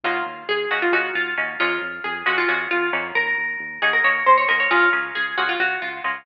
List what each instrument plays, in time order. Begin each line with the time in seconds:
0.04 synth bass 1 D#2, pizzicato strings A#3 C#4 D#4 F4 F#4
0.25 synth bass 1 D#2
0.48 synth bass 1 D#2, pizzicato strings G#4
0.71 synth bass 1 D#2, pizzicato strings A#3 C#4 D#4 F#4
0.82 pizzicato strings F4
0.92 synth bass 1 D#2, pizzicato strings A#3 C#4 D#4 F#4
1.15 synth bass 1 D#2, pizzicato strings F4
1.37 synth bass 1 D#2, pizzicato strings A#3 C#4 D#4 F#4
1.60 synth bass 1 F2, pizzicato strings G#3 A#3 C#4 F4
1.81 synth bass 1 F2
2.04 synth bass 1 F2, pizzicato strings G#4
2.26 synth bass 1 F2, pizzicato strings G#3 A#3 C#4 F4 F#4
2.38 pizzicato strings F4
2.48 synth bass 1 F2, pizzicato strings G#3 A#3 C#4 F4 F#4
2.71 synth bass 1 F2, pizzicato strings F4
2.93 synth bass 1 F2, pizzicato strings A#3 C#4 D#4 F#4
3.15 synth bass 1 D#2, pizzicato strings A#4
3.38 synth bass 1 D#2
3.60 synth bass 1 D#2
3.82 synth bass 1 D#2, pizzicato strings A#3 C#4 D#4 F#4 G#4
3.93 pizzicato strings A#4
4.04 synth bass 1 D#2, pizzicato strings A#3 C#4 D#4 F#4 C#5
4.26 synth bass 1 D#2, pizzicato strings C5
4.38 pizzicato strings C#5
4.48 synth bass 1 D#2, pizzicato strings A#3 C#4 D#4 F#4 A#4
4.60 pizzicato strings C#5
4.71 synth bass 1 C#2, pizzicato strings A#3 C#4 F4 G#4
4.93 synth bass 1 C#2, pizzicato strings A#3 C#4 F4 G#4
5.15 synth bass 1 C#2, pizzicato strings G#4
5.37 synth bass 1 C#2, pizzicato strings A#3 C#4 F4 F#4 G#4
5.49 pizzicato strings F4
5.60 synth bass 1 C#2, pizzicato strings F#4
5.82 synth bass 1 C#2, pizzicato strings F4
6.04 synth bass 1 C#2, pizzicato strings A#3 C#4 F4 G#4